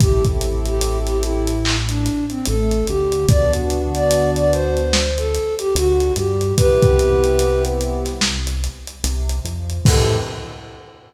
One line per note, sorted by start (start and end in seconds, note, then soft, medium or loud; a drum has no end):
0.00 2.10 A1 loud
0.00 1.51 C4 loud
0.00 1.51 E4 loud
0.00 1.51 G4 loud
0.00 0.24 G4 medium
0.00 1.51 A4 loud
0.00 kick loud
0.00 closed hi-hat loud
0.24 kick medium
0.24 closed hi-hat medium
0.41 closed hi-hat medium
0.65 0.98 G4 medium
0.65 closed hi-hat medium
0.81 closed hi-hat medium
1.07 1.23 G4 medium
1.07 snare soft
1.07 closed hi-hat medium
1.23 1.76 E4 medium
1.23 closed hi-hat medium
1.47 closed hi-hat medium
1.65 clap loud
1.89 2.25 D4 medium
1.89 closed hi-hat medium
2.06 snare soft
2.06 closed hi-hat medium
2.30 2.46 C4 medium
2.30 closed hi-hat medium
2.45 2.83 A1 loud
2.45 2.83 A3 medium
2.45 2.86 A4 medium
2.45 closed hi-hat medium
2.71 closed hi-hat medium
2.87 3.25 D2 medium
2.87 3.24 D3 medium
2.87 3.26 G4 medium
2.87 closed hi-hat medium
3.12 closed hi-hat medium
3.28 5.39 D2 loud
3.28 4.80 B3 loud
3.28 4.80 D4 loud
3.28 4.80 F#4 loud
3.28 3.52 D5 loud
3.28 kick loud
3.28 closed hi-hat medium
3.53 closed hi-hat medium
3.70 closed hi-hat medium
3.95 4.30 D5 loud
3.95 closed hi-hat medium
4.11 closed hi-hat loud
4.36 4.52 D5 loud
4.36 closed hi-hat medium
4.52 5.12 C5 medium
4.52 closed hi-hat medium
4.77 closed hi-hat medium
4.93 snare loud
5.18 5.55 A4 medium
5.18 closed hi-hat medium
5.35 closed hi-hat medium
5.59 5.74 G4 loud
5.59 closed hi-hat medium
5.75 6.11 D2 loud
5.75 6.11 D3 loud
5.75 6.14 F#4 loud
5.75 closed hi-hat loud
6.00 closed hi-hat medium
6.16 6.53 G2 medium
6.16 6.53 G3 medium
6.16 6.54 G4 medium
6.16 closed hi-hat medium
6.41 closed hi-hat medium
6.57 8.68 C2 loud
6.57 8.09 B3 medium
6.57 8.09 C4 loud
6.57 8.09 E4 medium
6.57 7.63 G4 medium
6.57 8.09 G4 loud
6.57 7.63 B4 loud
6.57 kick loud
6.57 closed hi-hat loud
6.82 kick loud
6.82 closed hi-hat medium
6.99 closed hi-hat medium
7.24 closed hi-hat medium
7.39 closed hi-hat medium
7.65 closed hi-hat medium
7.81 closed hi-hat medium
8.05 snare soft
8.05 closed hi-hat medium
8.21 snare loud
8.47 closed hi-hat medium
8.64 closed hi-hat medium
8.87 closed hi-hat medium
9.04 9.40 C2 medium
9.04 9.40 C3 medium
9.04 closed hi-hat loud
9.29 closed hi-hat medium
9.45 9.81 F2 medium
9.45 9.81 F3 medium
9.45 closed hi-hat medium
9.70 closed hi-hat medium
9.85 10.18 A2 loud
9.85 10.17 C4 loud
9.85 10.17 E4 medium
9.85 10.17 G4 loud
9.85 10.17 A4 loud
9.85 10.17 A4 medium
9.85 kick loud
9.85 crash loud